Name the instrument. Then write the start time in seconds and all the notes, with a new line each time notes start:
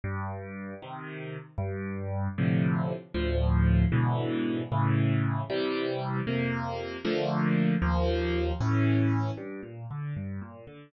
acoustic grand piano
0.04 G2
0.82 C3 D#3
1.58 G2
2.38 A2 C3 D3 F3
3.14 D2 A2 F3
3.92 G#2 B2 D3 E3
4.72 A2 C#3 E3
5.50 C3 E3 G3
6.27 F2 C3 A#3
7.05 D3 F3 A3 A#3
7.82 D#2 F3 A#3
8.60 A2 E3 C#4
9.37 G2
9.63 A#2
9.91 D3
10.16 G2
10.41 A#2
10.67 D3